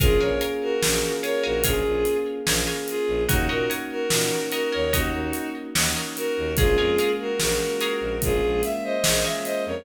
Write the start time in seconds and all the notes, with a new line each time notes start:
0.00 A#1 A#3 C#4 F4 G#4 A#4 C#5 F5 G#5, kick, closed hi-hat
0.05 F4 G#4
0.20 A#1 A#4 C#5 F5 G#5
0.41 A#4 C#5 F5 G#5, closed hi-hat
0.62 F#4 A#4
0.83 A#1 A#3 C#4, snare
0.89 F4 G#4
1.23 A#4 C#5 F5 G#5, closed hi-hat
1.43 A#1 F#4 A#4 C#5 F5 G#5
1.64 A#1 A#3 F4 G#4 A#4 C#5 F5 G#5, kick, closed hi-hat
1.68 C#4 F4
1.73 G#4
1.86 A#1
2.05 closed hi-hat
2.45 A#1 A#3 C#4 A#4 C#5 F5 G#5, snare
2.51 F4 G#4
2.67 A#4 C#5 F5 G#5
2.88 F4 G#4, closed hi-hat
3.08 A#1
3.27 D#2 A#3 C#4 D#4 F#4 A#4 C#5 D#5 F#5, kick, closed hi-hat
3.33 D#4 F#4
3.49 A#2 F#4 A#4 C#5 D#5 F#5
3.70 A#4 C#5 D#5 F#5, closed hi-hat
3.91 F#4 A#4
4.10 A#2 A#3 C#4, snare
4.17 D#4 F#4
4.52 F#4 A#4 C#5 D#5 F#5, closed hi-hat
4.72 D#2 A#4 C#5 D#5 F#5
4.92 D#2 A#3 D#4 F#4 A#4 C#5 D#5 F#5, kick, closed hi-hat
4.97 C#4 D#4
5.02 F#4
5.13 D#2
5.33 closed hi-hat
5.75 D#2 A#3 C#4 A#4 C#5 D#5 F#5, snare
5.81 D#4 F#4
5.96 A#4 C#5 D#5 F#5
6.16 F#4 A#4, closed hi-hat
6.37 D#2
6.56 A#1 G#3 A#3 F4 G#4 A#4 C#5 F5, kick, closed hi-hat
6.62 C#4 F4
6.78 F2 G#4 A#4 C#5 F5
6.98 G#4 A#4 C#5 F5, closed hi-hat
7.20 F#4 A#4
7.40 A#1 G#3 A#3 F#4 A#4, snare
7.46 C#4 F4
7.80 G#4 A#4 C#5 F5, closed hi-hat
8.01 A#1
8.20 A#1 G#3 A#3 F4 G#4, kick, closed hi-hat
8.26 C#4 F4
8.43 A#1
8.63 E5, snare, closed hi-hat
8.84 C5 D#5
9.04 A#1 G#3 G#4 A#4 C#5 F5, snare
9.09 A#3 C#4
9.14 F4
9.24 G#4 A#4 C#5 E5 F5
9.44 C5 D#5, closed hi-hat
9.66 F2 A#4 C#5